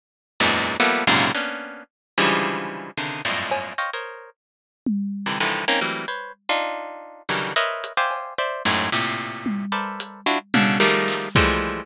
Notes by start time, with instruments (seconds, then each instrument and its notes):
0.40 orchestral harp E2 F#2 G#2 A#2
0.80 orchestral harp F3 G3 A3 A#3 B3, closed hi-hat
1.07 orchestral harp F#2 G#2 A#2 C3 C#3
1.35 orchestral harp A#3 B3 C#4 D4
2.18 orchestral harp C#3 D3 E3 F3 G3 G#3
2.97 orchestral harp C3 C#3 D3 D#3
3.25 orchestral harp F2 F#2 G2 G#2 A2 A#2
3.51 cowbell
3.78 orchestral harp C5 C#5 D#5 F5 G5
3.93 orchestral harp A#4 C5 C#5 D#5
4.86 high tom
5.26 orchestral harp C3 D3 D#3 E3
5.40 orchestral harp C3 D3 D#3 E3 F3
5.68 orchestral harp A#3 C4 C#4 D#4
5.81 orchestral harp E3 F#3 G3 A3 A#3 C4
6.08 orchestral harp B4 C5 C#5
6.49 orchestral harp D4 D#4 F4
7.29 orchestral harp C#3 D3 D#3 E3 F#3 G3
7.56 orchestral harp A#4 B4 C5 C#5 D#5 E5
7.84 closed hi-hat
7.97 orchestral harp C5 D5 E5 F5 G5 G#5
8.11 cowbell
8.38 orchestral harp C5 D5 E5
8.65 orchestral harp F#2 G#2 A2
8.92 orchestral harp A2 A#2 C3
9.46 high tom
9.72 orchestral harp A4 A#4 B4 C5 D5 E5
10.00 closed hi-hat
10.26 orchestral harp D4 E4 F4 F#4
10.54 orchestral harp B2 C#3 D3, high tom
10.80 orchestral harp D#3 F3 G3 G#3 A3 A#3
11.08 clap
11.35 orchestral harp E3 F3 G3 G#3 A3, kick